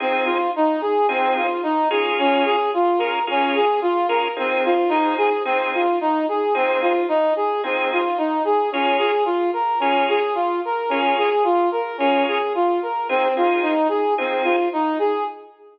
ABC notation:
X:1
M:4/4
L:1/8
Q:1/4=110
K:Fm
V:1 name="Brass Section"
C F E A C F E A | D A F B D A F B | C F E A C F E A | C F E A C F E A |
D A F B D A F B | D A F B D A F B | C F E A C F E A |]
V:2 name="Drawbar Organ"
[F,CEA]4 [F,CEA]3 [B,DFA]- | [B,DFA]3 [B,DFA] [B,DFA]3 [B,DFA] | [F,CEA]2 [F,CEA]2 [F,CEA]4 | [F,CEA]4 [F,CEA]4 |
[B,DFA]4 [B,DFA]4 | [B,DFA]4 [B,DFA]4 | [F,CEA] [F,CEA]3 [F,CEA]4 |]